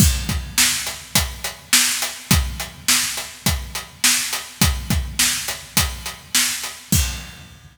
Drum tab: CC |x-------|--------|--------|x-------|
HH |-x-xxx-x|xx-xxx-x|xx-xxx-x|--------|
SD |--o---o-|--o---o-|--o---o-|--------|
BD |oo--o---|o---o---|oo--o---|o-------|